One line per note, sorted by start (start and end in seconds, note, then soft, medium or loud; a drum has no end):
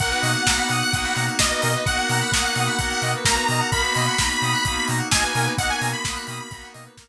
0.00 0.13 B1 medium
0.00 0.42 A#3 medium
0.00 1.86 A#3 medium
0.00 0.42 B3 medium
0.00 1.86 B3 medium
0.00 0.42 D#4 medium
0.00 1.86 D#4 medium
0.00 0.42 F#4 medium
0.00 1.86 F#4 medium
0.00 0.10 A#4 medium
0.00 1.24 F#5 loud
0.00 kick loud
0.00 closed hi-hat loud
0.10 0.21 B4 medium
0.10 closed hi-hat medium
0.22 0.36 B2 medium
0.22 0.32 D#5 medium
0.22 open hi-hat loud
0.34 0.45 F#5 medium
0.34 closed hi-hat medium
0.47 0.60 B1 medium
0.47 0.88 A#3 medium
0.47 0.88 B3 medium
0.47 0.88 D#4 medium
0.47 0.88 F#4 medium
0.47 0.57 A#5 medium
0.47 kick loud
0.47 snare loud
0.57 0.68 B5 medium
0.57 closed hi-hat medium
0.69 0.82 B2 medium
0.69 0.81 D#6 medium
0.69 open hi-hat medium
0.81 0.92 F#6 medium
0.81 closed hi-hat medium
0.92 1.06 B1 medium
0.92 1.35 A#3 medium
0.92 1.35 B3 medium
0.92 1.35 D#4 medium
0.92 1.35 F#4 medium
0.92 1.02 D#6 medium
0.92 kick loud
0.92 closed hi-hat loud
1.04 1.14 B5 medium
1.04 closed hi-hat medium
1.16 1.29 B2 medium
1.16 1.26 A#5 medium
1.16 open hi-hat medium
1.27 1.38 F#5 medium
1.27 closed hi-hat medium
1.39 1.52 B1 medium
1.39 1.81 A#3 medium
1.39 1.81 B3 medium
1.39 1.81 D#4 medium
1.39 1.81 F#4 medium
1.39 1.81 D#5 loud
1.39 1.50 D#5 medium
1.39 kick loud
1.39 snare loud
1.50 1.61 B4 medium
1.50 closed hi-hat medium
1.62 1.76 B2 medium
1.62 1.72 A#4 medium
1.62 open hi-hat loud
1.75 1.86 B4 medium
1.75 closed hi-hat medium
1.86 1.99 B1 medium
1.86 2.28 A#3 medium
1.86 3.71 A#3 medium
1.86 2.28 B3 medium
1.86 3.71 B3 medium
1.86 2.28 D#4 medium
1.86 2.28 F#4 medium
1.86 3.71 F#4 medium
1.86 3.71 A#4 medium
1.86 1.97 D#5 medium
1.86 3.11 F#5 loud
1.86 kick loud
1.86 closed hi-hat loud
1.98 2.09 F#5 medium
1.98 closed hi-hat medium
2.09 2.22 B2 medium
2.09 2.21 A#5 medium
2.09 open hi-hat loud
2.21 2.32 B5 medium
2.21 closed hi-hat medium
2.32 2.45 B1 medium
2.32 2.74 A#3 medium
2.32 2.74 B3 medium
2.32 2.74 D#4 medium
2.32 2.74 F#4 medium
2.32 2.43 D#6 medium
2.32 kick loud
2.32 snare loud
2.44 2.54 F#6 medium
2.44 closed hi-hat medium
2.56 2.69 B2 medium
2.56 2.67 D#6 medium
2.56 open hi-hat medium
2.67 2.77 B5 medium
2.67 closed hi-hat medium
2.79 2.92 B1 medium
2.79 3.21 A#3 medium
2.79 3.21 B3 medium
2.79 3.21 D#4 medium
2.79 3.21 F#4 medium
2.79 2.89 A#5 medium
2.79 kick loud
2.79 closed hi-hat loud
2.91 3.02 F#5 medium
2.91 closed hi-hat medium
3.02 3.15 B2 medium
3.02 3.13 D#5 medium
3.02 open hi-hat medium
3.14 3.26 B4 medium
3.14 closed hi-hat medium
3.25 3.38 B1 medium
3.25 3.67 A#3 medium
3.25 3.67 B3 medium
3.25 3.67 D#4 medium
3.25 3.67 F#4 medium
3.25 3.35 A#4 medium
3.25 3.68 A#5 medium
3.25 kick loud
3.25 snare loud
3.35 3.46 B4 medium
3.35 closed hi-hat medium
3.48 3.62 B2 medium
3.48 3.61 D#5 medium
3.48 open hi-hat medium
3.60 3.71 F#5 medium
3.60 closed hi-hat medium
3.72 3.85 B1 medium
3.72 5.56 A#3 medium
3.72 4.14 A#3 medium
3.72 5.56 B3 medium
3.72 4.14 B3 medium
3.72 5.56 D#4 medium
3.72 4.14 D#4 medium
3.72 5.56 F#4 medium
3.72 4.14 F#4 medium
3.72 3.82 A#4 loud
3.72 4.85 B5 loud
3.72 kick loud
3.72 closed hi-hat loud
3.83 3.93 B4 medium
3.83 closed hi-hat medium
3.95 4.09 B2 medium
3.95 4.06 D#5 medium
3.95 open hi-hat medium
4.07 4.17 F#5 medium
4.07 closed hi-hat medium
4.18 4.31 B1 medium
4.18 4.61 A#3 medium
4.18 4.61 B3 medium
4.18 4.61 D#4 medium
4.18 4.61 F#4 medium
4.18 4.29 A#5 medium
4.18 kick loud
4.18 snare loud
4.30 4.40 B5 medium
4.30 closed hi-hat medium
4.42 4.55 B2 medium
4.42 4.52 D#6 medium
4.42 open hi-hat medium
4.53 4.63 F#6 medium
4.53 closed hi-hat medium
4.64 4.78 B1 medium
4.64 5.07 A#3 medium
4.64 5.07 B3 medium
4.64 5.07 D#4 medium
4.64 5.07 F#4 medium
4.64 4.75 D#6 medium
4.64 kick loud
4.64 closed hi-hat loud
4.76 4.87 B5 medium
4.76 closed hi-hat medium
4.88 5.01 B2 medium
4.88 5.00 A#5 medium
4.88 open hi-hat loud
4.98 5.09 F#5 medium
4.98 closed hi-hat medium
5.11 5.25 B1 medium
5.11 5.53 A#3 medium
5.11 5.53 B3 medium
5.11 5.53 D#4 medium
5.11 5.53 F#4 medium
5.11 5.23 D#5 medium
5.11 5.50 G#5 loud
5.11 kick loud
5.11 snare loud
5.23 5.33 B4 medium
5.23 closed hi-hat medium
5.35 5.48 B2 medium
5.35 5.46 A#4 medium
5.35 open hi-hat loud
5.45 5.56 B4 medium
5.45 closed hi-hat medium
5.58 5.71 B1 medium
5.58 6.00 A#3 medium
5.58 7.08 A#3 medium
5.58 6.00 B3 medium
5.58 7.08 B3 medium
5.58 6.00 D#4 medium
5.58 6.00 F#4 medium
5.58 7.08 F#4 medium
5.58 7.08 A#4 medium
5.58 5.70 D#5 medium
5.58 5.69 F#5 loud
5.58 kick loud
5.58 closed hi-hat loud
5.69 5.80 F#5 medium
5.69 5.91 G#5 loud
5.69 closed hi-hat medium
5.81 5.94 B2 medium
5.81 5.92 A#5 medium
5.81 open hi-hat loud
5.93 6.03 B5 medium
5.93 6.66 B5 medium
5.93 closed hi-hat medium
6.05 6.18 B1 medium
6.05 6.47 A#3 medium
6.05 6.47 B3 medium
6.05 6.47 D#4 medium
6.05 6.47 F#4 medium
6.05 6.15 D#6 medium
6.05 kick loud
6.05 snare loud
6.14 6.25 F#6 medium
6.14 closed hi-hat medium
6.27 6.40 B2 medium
6.27 6.40 D#6 medium
6.27 open hi-hat loud
6.39 6.50 B5 medium
6.39 closed hi-hat medium
6.51 6.64 B1 medium
6.51 6.93 A#3 medium
6.51 6.93 B3 medium
6.51 6.93 D#4 medium
6.51 6.93 F#4 medium
6.51 6.62 A#5 medium
6.51 kick loud
6.51 closed hi-hat loud
6.62 6.73 F#5 medium
6.62 closed hi-hat medium
6.74 6.88 B2 medium
6.74 6.84 D#5 medium
6.74 open hi-hat loud
6.85 6.96 B4 medium
6.85 closed hi-hat medium
6.97 7.08 B1 medium
6.97 7.08 A#3 medium
6.97 7.08 B3 medium
6.97 7.08 D#4 medium
6.97 7.08 F#4 medium
6.97 7.08 A#4 medium
6.97 kick loud
6.97 snare loud
7.07 7.08 B4 medium